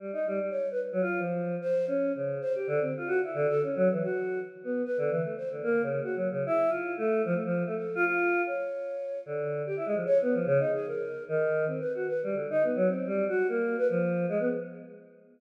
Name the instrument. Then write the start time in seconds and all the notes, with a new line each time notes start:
choir aahs
0.00 G3
0.13 D#4
0.27 G3
0.41 G3
0.50 C#5
0.71 B4
0.92 F#3
1.01 F4
1.19 F3
1.61 C5
1.87 C#4
2.15 C#3
2.41 C5
2.55 G4
2.67 D3
2.81 C4
2.97 F4
3.07 F#4
3.24 E4
3.34 D3
3.48 A4
3.63 C#4
3.76 F#3
3.91 E3
4.03 F#4
4.64 B3
4.85 B4
4.98 D3
5.11 E3
5.22 A3
5.37 C5
5.50 D3
5.63 A#3
5.82 C#3
6.03 F#4
6.16 F#3
6.31 C#3
6.46 E4
6.69 F4
6.98 A3
7.25 F3
7.34 A3
7.45 F3
7.66 A3
7.76 A4
7.95 F4
8.05 F4
8.46 C#5
9.26 D3
9.66 G4
9.77 E4
9.86 G#3
9.95 F3
10.06 C#5
10.22 B3
10.33 F3
10.46 C#3
10.59 D#4
10.73 G#4
10.86 A#4
11.29 D#3
11.67 C4
11.80 B4
11.95 F#4
12.08 B4
12.23 G3
12.34 D3
12.50 D#4
12.63 B3
12.76 F#3
12.88 C4
13.07 G3
13.29 F#4
13.49 A#3
13.78 B4
13.89 F3
14.29 G#3
14.40 B3